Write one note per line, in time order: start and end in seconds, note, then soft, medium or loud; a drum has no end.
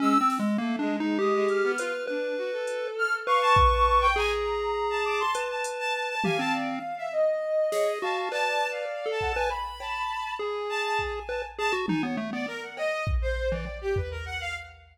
0.00 0.13 G#3 medium
0.00 0.18 C#4 loud
0.00 0.28 E6 loud
0.21 0.38 C4 medium
0.30 snare medium
0.39 0.57 G#3 medium
0.58 0.77 A3 medium
0.58 0.76 A#3 loud
0.79 0.97 G#3 medium
0.79 0.97 D4 medium
0.99 1.17 G#3 medium
0.99 1.18 D#4 loud
1.19 1.32 G#3 medium
1.19 1.72 G4 loud
1.19 1.46 D#6 medium
1.34 1.47 G#3 medium
1.49 1.62 G#3 medium
1.49 2.03 F6 medium
1.49 closed hi-hat medium
1.63 1.77 B3 medium
1.78 1.92 F4 loud
1.78 2.06 B4 medium
1.78 closed hi-hat loud
2.07 2.35 D4 medium
2.07 2.88 B4 medium
2.37 2.51 F#4 medium
2.52 3.19 A4 medium
2.67 closed hi-hat medium
2.98 3.12 F6 loud
3.27 4.07 B4 loud
3.27 3.40 F5 medium
3.27 4.07 C#6 loud
3.42 3.55 A5 loud
3.56 kick loud
3.72 3.85 A5 medium
3.86 4.00 A5 medium
4.01 4.14 G5 loud
4.16 5.23 G#4 medium
4.16 4.29 G#5 loud
4.16 4.98 A#5 medium
4.90 5.03 A5 loud
5.05 5.45 A5 medium
5.05 5.18 D6 loud
5.20 5.34 C6 loud
5.35 6.15 B4 medium
5.35 closed hi-hat loud
5.50 5.63 A5 medium
5.64 5.78 A5 medium
5.64 closed hi-hat loud
5.79 5.93 A5 loud
5.94 6.07 A5 medium
6.09 6.22 A5 loud
6.24 6.38 G4 medium
6.24 7.04 F5 medium
6.24 6.37 G#5 loud
6.24 high tom loud
6.38 6.79 C4 medium
6.38 6.52 A5 loud
6.54 6.67 D5 medium
6.98 7.11 E5 medium
7.12 7.92 D#5 medium
7.72 7.99 G#4 medium
7.72 7.86 C#5 medium
7.72 snare medium
7.87 8.01 D#5 medium
8.02 8.29 F#4 medium
8.02 8.29 F5 medium
8.02 8.15 A5 medium
8.17 8.30 A5 medium
8.31 8.85 B4 medium
8.31 9.11 D5 medium
8.31 8.67 A5 loud
8.31 clap medium
8.71 9.07 F5 medium
9.06 9.32 A4 medium
9.11 9.47 A5 medium
9.21 9.35 F#5 medium
9.21 kick medium
9.36 9.50 B4 loud
9.36 9.49 G#5 loud
9.50 10.30 B5 loud
9.80 10.34 A5 medium
9.80 cowbell loud
10.39 11.20 G#4 medium
10.39 11.47 G#5 soft
10.69 10.83 A5 loud
10.84 10.98 A5 loud
10.99 11.12 A5 medium
10.99 kick medium
11.29 11.42 B4 medium
11.29 11.42 A5 medium
11.29 cowbell medium
11.58 11.72 G#4 medium
11.58 11.72 A5 loud
11.73 11.86 F#4 medium
11.88 12.02 D#4 loud
11.88 12.01 G#5 medium
11.88 high tom loud
12.03 12.16 B3 loud
12.03 12.16 C#5 medium
12.17 12.31 A3 medium
12.32 12.46 B3 medium
12.32 12.46 D5 medium
12.47 12.61 A#4 loud
12.62 12.75 F#5 medium
12.77 13.04 D#5 loud
12.77 cowbell loud
13.07 kick loud
13.22 13.48 C5 medium
13.51 13.65 E3 medium
13.51 13.78 D5 medium
13.66 cowbell medium
13.81 13.95 G4 loud
13.96 14.10 B4 medium
13.96 floor tom loud
14.11 14.24 A#4 medium
14.26 14.39 F#5 loud
14.41 14.54 F5 loud